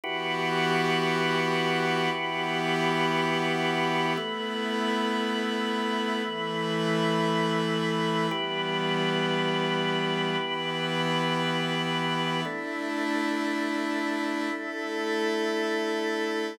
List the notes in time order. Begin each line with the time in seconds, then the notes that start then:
0.03 E3 B3 E4 F#4 G4 B4
2.11 E3 B3 E4 G4
4.17 A3 B3 E4 B4
6.24 E3 A3 E4
8.31 E3 G3 B3 E4 G4 B4
10.38 E3 B3 E4
12.45 A3 D4 E4
14.52 A3 E4 A4